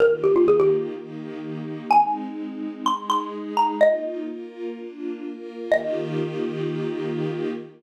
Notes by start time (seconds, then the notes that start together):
0.00 D#3 A#3 F4 G4 A#4
0.24 G4
0.36 F4
0.48 G#4
0.60 G4
0.95 D#3 A#3 D#4 G4
1.91 G#3 C4 D#4 G#5
2.86 G#3 D#4 G#4 C6
3.10 C6
3.57 A#5
3.81 A#3 D#4 F4 D#5
4.28 A#3 F4 A#4
4.76 A#3 D4 F4
5.23 A#3 F4 A#4
5.72 D#3 A#3 F4 G4 D#5